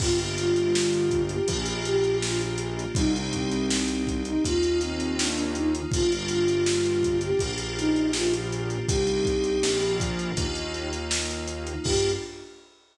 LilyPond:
<<
  \new Staff \with { instrumentName = "Flute" } { \time 4/4 \key g \minor \tempo 4 = 81 f'16 r16 f'4~ f'16 g'16 r8 g'8 f'16 r8. | ees'16 r16 c'4~ c'16 ees'16 f'8 c'8 d'16 d'16 ees'16 r16 | f'16 r16 f'4~ f'16 g'16 r8 ees'8 f'16 r8. | g'4. r2 r8 |
g'4 r2. | }
  \new Staff \with { instrumentName = "Electric Piano 2" } { \time 4/4 \key g \minor <bes d' f' g'>2 <bes d' f' g'>2 | <c' ees' g'>2 <bes ees' f'>2 | <bes d' f' g'>2 <bes d' f' g'>2 | <c' ees' g'>4 <bes d' f'>4 <bes ees' f'>2 |
<bes d' f' g'>4 r2. | }
  \new Staff \with { instrumentName = "Synth Bass 1" } { \clef bass \time 4/4 \key g \minor g,,2 bes,,2 | c,2 ees,2 | g,,2 bes,,2 | c,4 bes,,4 ees,2 |
g,4 r2. | }
  \new Staff \with { instrumentName = "Pad 5 (bowed)" } { \time 4/4 \key g \minor <bes d' f' g'>2 <bes d' f' g'>2 | <c' ees' g'>2 <bes ees' f'>2 | <bes d' f' g'>2 <bes d' f' g'>2 | <c' ees' g'>4 <bes d' f'>4 <bes ees' f'>2 |
<bes d' f' g'>4 r2. | }
  \new DrumStaff \with { instrumentName = "Drums" } \drummode { \time 4/4 <cymc bd>16 hh16 hh16 hh16 sn16 hh16 <hh bd>16 hh16 <hh bd>16 hh16 hh16 hh16 sn16 hh16 hh16 hh16 | <hh bd>16 hh16 <hh bd>16 hh16 sn16 hh16 <hh bd>16 hh16 <hh bd>16 hh16 hh16 hh16 sn16 hh16 hh16 hh16 | <hh bd>16 hh16 hh16 hh16 sn16 hh16 <hh bd>16 hh16 <hh bd>16 hh16 hh16 hh16 sn16 hh16 hh16 hh16 | <hh bd>16 hh16 <hh bd>16 hh16 sn16 hh16 <hh bd>16 hh16 <hh bd>16 hh16 hh16 hh16 sn16 hh16 hh16 hh16 |
<cymc bd>4 r4 r4 r4 | }
>>